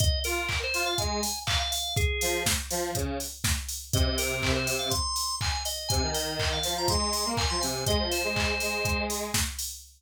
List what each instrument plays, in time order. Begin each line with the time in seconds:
0.00 drawbar organ D#5, kick, closed hi-hat
0.24 lead 1 (square) F4, drawbar organ A#4, open hi-hat
0.49 kick, clap
0.64 drawbar organ C5
0.74 lead 1 (square) F4, open hi-hat
0.86 drawbar organ F5
0.98 lead 1 (square) G#3, drawbar organ G#5, kick, closed hi-hat
1.23 open hi-hat
1.47 drawbar organ F5, kick, clap
1.60 drawbar organ F5
1.72 drawbar organ F5, open hi-hat
1.97 drawbar organ G#4, kick, closed hi-hat
2.21 lead 1 (square) F3, open hi-hat
2.46 kick, snare
2.70 lead 1 (square) F3, open hi-hat
2.95 lead 1 (square) C#3, kick, closed hi-hat
3.20 open hi-hat
3.44 kick, snare
3.69 open hi-hat
3.93 lead 1 (square) C3, drawbar organ D#5, kick, closed hi-hat
4.06 lead 1 (square) C3
4.18 drawbar organ A#4, open hi-hat
4.42 kick, clap
4.56 drawbar organ C5
4.67 open hi-hat
4.79 drawbar organ F5
4.90 drawbar organ C6, kick, closed hi-hat
5.16 open hi-hat
5.41 drawbar organ G#5, kick, clap
5.52 drawbar organ G#5
5.65 drawbar organ D#5, open hi-hat
5.89 lead 1 (square) C3, drawbar organ G#5, kick, closed hi-hat
6.02 lead 1 (square) D#3
6.14 drawbar organ D#5, open hi-hat
6.39 kick, clap
6.53 drawbar organ F5
6.63 lead 1 (square) F3, open hi-hat
6.78 drawbar organ A#5
6.88 lead 1 (square) G#3, drawbar organ C6, kick, closed hi-hat
7.13 open hi-hat
7.25 lead 1 (square) A#3
7.37 drawbar organ G#5, kick, clap
7.50 lead 1 (square) F3, drawbar organ C6
7.61 lead 1 (square) C3, drawbar organ G#5, open hi-hat
7.86 lead 1 (square) G#3, drawbar organ D#5, kick, closed hi-hat
7.99 lead 1 (square) F3
8.11 drawbar organ C5, open hi-hat
8.24 lead 1 (square) G#3
8.36 kick, clap
8.60 lead 1 (square) G#3, open hi-hat
8.85 kick, closed hi-hat
9.10 open hi-hat
9.34 kick, snare
9.59 open hi-hat